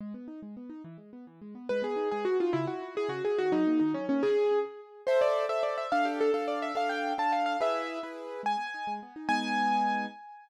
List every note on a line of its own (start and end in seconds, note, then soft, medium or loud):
0.01 0.13 G#3 medium
0.14 0.27 B3 medium
0.28 0.40 D#4 medium
0.42 0.55 G#3 medium
0.57 0.69 B3 medium
0.70 0.82 D#4 medium
0.84 0.97 E3 loud
0.98 1.11 G#3 medium
1.13 1.26 B3 medium
1.27 1.40 E3 medium
1.41 1.54 G#3 medium
1.55 1.68 B3 medium
1.69 1.83 G#3 loud
1.69 1.81 B4 medium
1.82 1.95 B3 medium
1.82 2.09 G#4 medium
1.96 2.09 D#4 medium
2.11 2.25 G#3 medium
2.11 2.24 G#4 medium
2.25 2.37 B3 medium
2.25 2.37 F#4 medium
2.40 2.53 D#4 medium
2.40 2.54 F4 medium
2.53 2.66 C#3 loud
2.53 2.65 E4 medium
2.67 2.80 E4 medium
2.67 2.94 F#4 medium
2.82 2.95 E4 medium
2.95 3.08 E4 medium
2.95 3.10 G#4 medium
3.09 3.21 C#3 medium
3.09 3.22 F#4 medium
3.25 3.37 E4 medium
3.25 3.38 G#4 medium
3.38 3.52 D#3 loud
3.38 3.52 F#4 medium
3.52 3.65 F#3 medium
3.52 3.79 D#4 medium
3.67 3.80 A#3 medium
3.79 3.94 D#3 medium
3.79 3.92 D#4 medium
3.94 4.07 F#3 medium
3.94 4.06 C#4 medium
4.09 4.21 A#3 medium
4.09 4.22 C#4 medium
4.23 4.59 G#4 medium
5.07 5.46 A4 loud
5.07 5.19 C5 medium
5.07 5.46 C5 loud
5.07 5.46 E5 loud
5.21 5.45 D5 medium
5.49 5.87 A4 loud
5.49 5.87 C5 medium
5.49 5.62 E5 medium
5.49 5.87 E5 medium
5.63 5.76 D5 medium
5.78 5.91 E5 medium
5.92 6.30 D4 loud
5.92 6.30 A4 loud
5.92 6.06 F5 medium
5.92 6.30 F5 loud
6.05 6.19 G4 medium
6.21 6.32 A4 medium
6.34 6.72 D4 medium
6.34 6.45 A4 medium
6.34 6.72 A4 medium
6.34 6.72 F5 loud
6.48 6.59 D5 medium
6.62 6.74 E5 medium
6.75 7.13 D4 loud
6.75 7.13 A4 loud
6.75 7.13 F5 loud
6.75 6.88 F5 medium
6.89 7.13 G5 medium
7.18 7.56 D4 medium
7.18 7.56 A4 medium
7.18 7.56 F5 medium
7.18 7.32 A5 medium
7.32 7.45 F5 medium
7.46 7.58 F5 medium
7.61 7.99 E4 loud
7.61 7.99 G#4 loud
7.61 7.99 B4 loud
7.61 8.00 E5 medium
8.03 8.41 E4 medium
8.03 8.41 G#4 medium
8.03 8.41 B4 loud
8.43 8.56 G#3 medium
8.43 8.93 G#5 medium
8.57 8.70 B3 medium
8.74 8.87 D#4 medium
8.87 9.00 G#3 medium
9.03 9.15 B3 medium
9.16 9.28 D#4 medium
9.29 10.06 G#3 medium
9.29 10.06 B3 loud
9.29 10.06 D#4 loud
9.29 10.06 G#5 loud